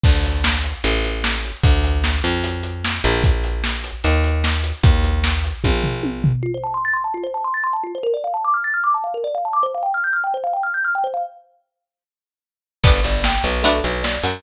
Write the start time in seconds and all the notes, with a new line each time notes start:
0.04 D2, kick, crash
0.23 closed hi-hat
0.44 snare
0.64 closed hi-hat
0.84 A1, closed hi-hat
1.05 closed hi-hat
1.24 snare
1.44 closed hi-hat
1.64 D2, kick, closed hi-hat
1.84 closed hi-hat
2.04 snare
2.24 F2, closed hi-hat
2.44 closed hi-hat
2.63 closed hi-hat
2.85 snare
3.04 A#1, closed hi-hat
3.24 kick, closed hi-hat
3.44 closed hi-hat
3.64 snare
3.84 closed hi-hat
4.04 D#2, closed hi-hat
4.24 closed hi-hat
4.44 snare
4.64 closed hi-hat
4.83 D#2, kick, closed hi-hat
5.04 closed hi-hat
5.24 snare
5.44 closed hi-hat
5.64 A#1, kick, high tom
5.84 floor tom
6.03 high tom
6.24 floor tom
6.43 F4
6.54 C5
6.64 A5
6.74 C6
6.85 A6
6.94 C6
7.04 A5
7.14 F4
7.24 C5
7.34 A5
7.44 C6
7.54 A6
7.64 C6
7.73 A5
7.84 F4
7.95 C5
8.03 A#4
8.14 D5
8.24 F5
8.34 A5
8.45 D6
8.54 F6
8.64 A6
8.74 F6
8.84 D6
8.94 A5
9.04 F5
9.14 A#4
9.24 D5
9.35 F5
9.45 A5
9.53 D6
9.63 C5
9.75 F5
9.83 G5
9.94 F6
10.04 G6
10.13 F6
10.24 G5
10.34 C5
10.44 F5
10.53 G5
10.63 F6
10.74 G6
10.85 F6
10.95 G5
11.04 C5
11.14 F5
12.84 G1 B3 D4 G4 B4, kick, crash
13.04 G1 D5, closed hi-hat
13.24 G5, snare
13.44 B1 B4, closed hi-hat
13.63 A3 B3 D4 F#4 A4, closed hi-hat
13.84 B1 B4, closed hi-hat
14.03 D5, snare
14.24 F#2 F#5, snare, closed hi-hat